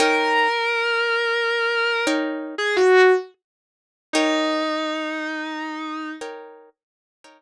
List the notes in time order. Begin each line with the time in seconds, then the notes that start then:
0.00 D#4 A#4 C#5 G5
2.07 D#4 A#4 C#5 G5
2.58 G#4
2.76 F#4
4.13 D#4 A#4 C#5 G5
6.21 D#4 A#4 C#5 G5
7.24 D#4 A#4 C#5 G5